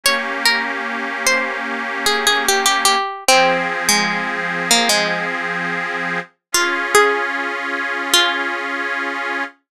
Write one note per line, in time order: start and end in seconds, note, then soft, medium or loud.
0.04 2.96 A#3 medium
0.04 2.96 C#4 medium
0.04 2.96 G4 medium
0.04 0.39 C#5 loud
0.45 0.84 A#4 medium
1.27 1.61 C5 medium
2.06 2.26 G#4 medium
2.27 2.46 G#4 medium
2.48 2.65 G4 medium
2.66 2.85 G4 medium
2.85 3.24 G4 medium
3.28 6.20 F3 medium
3.28 6.20 C4 medium
3.28 3.83 C4 medium
3.28 6.20 G#4 medium
3.89 4.62 G#3 medium
4.71 4.90 A#3 medium
4.89 5.26 G#3 medium
6.52 9.44 C#4 medium
6.52 9.44 F4 medium
6.52 6.88 F4 medium
6.52 9.44 G#4 medium
6.95 8.11 G#4 medium
8.14 9.69 F4 medium